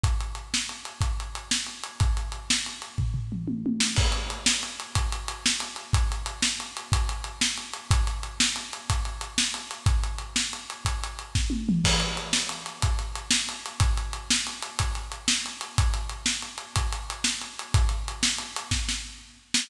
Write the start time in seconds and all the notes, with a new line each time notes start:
0.03 kick, closed hi-hat
0.20 closed hi-hat
0.35 closed hi-hat
0.54 snare
0.69 closed hi-hat
0.85 closed hi-hat
1.01 kick, closed hi-hat
1.20 closed hi-hat
1.35 closed hi-hat
1.51 snare
1.67 closed hi-hat
1.84 closed hi-hat
2.00 kick, closed hi-hat
2.17 closed hi-hat
2.32 closed hi-hat
2.50 snare
2.66 closed hi-hat
2.82 closed hi-hat
2.98 kick, floor tom
3.14 floor tom
3.32 mid tom
3.48 high tom
3.66 high tom
3.80 snare
3.96 kick, crash
4.12 closed hi-hat
4.30 closed hi-hat
4.46 snare
4.63 closed hi-hat
4.80 closed hi-hat
4.95 kick, closed hi-hat
5.12 closed hi-hat
5.28 closed hi-hat
5.46 snare
5.60 closed hi-hat
5.76 closed hi-hat
5.93 kick, closed hi-hat
6.12 closed hi-hat
6.26 closed hi-hat
6.42 snare
6.60 closed hi-hat
6.77 closed hi-hat
6.92 kick, closed hi-hat
7.09 closed hi-hat
7.24 closed hi-hat
7.41 snare
7.58 closed hi-hat
7.73 closed hi-hat
7.91 kick, closed hi-hat
8.07 closed hi-hat
8.23 closed hi-hat
8.40 snare
8.56 closed hi-hat
8.73 closed hi-hat
8.90 kick, closed hi-hat
9.05 closed hi-hat
9.21 closed hi-hat
9.38 snare
9.54 closed hi-hat
9.71 closed hi-hat
9.86 kick, closed hi-hat
10.04 closed hi-hat
10.18 closed hi-hat
10.36 snare
10.53 closed hi-hat
10.70 closed hi-hat
10.85 kick, closed hi-hat
11.04 closed hi-hat
11.19 closed hi-hat
11.35 kick, snare
11.50 high tom
11.69 mid tom
11.84 kick, crash
12.00 closed hi-hat
12.17 closed hi-hat
12.33 snare
12.49 closed hi-hat
12.66 closed hi-hat
12.82 kick, closed hi-hat
12.99 closed hi-hat
13.15 closed hi-hat
13.31 snare
13.49 closed hi-hat
13.66 closed hi-hat
13.80 kick, closed hi-hat
13.97 closed hi-hat
14.13 closed hi-hat
14.30 snare
14.47 closed hi-hat
14.63 closed hi-hat
14.79 kick, closed hi-hat
14.95 closed hi-hat
15.12 closed hi-hat
15.28 snare
15.46 closed hi-hat
15.61 closed hi-hat
15.78 kick, closed hi-hat
15.94 closed hi-hat
16.09 closed hi-hat
16.26 snare
16.42 closed hi-hat
16.58 closed hi-hat
16.76 kick, closed hi-hat
16.92 closed hi-hat
17.10 closed hi-hat
17.24 snare
17.41 closed hi-hat
17.59 closed hi-hat
17.74 kick, closed hi-hat
17.89 closed hi-hat
18.08 closed hi-hat
18.23 snare
18.38 closed hi-hat
18.56 closed hi-hat
18.71 kick, snare
18.89 snare
19.54 snare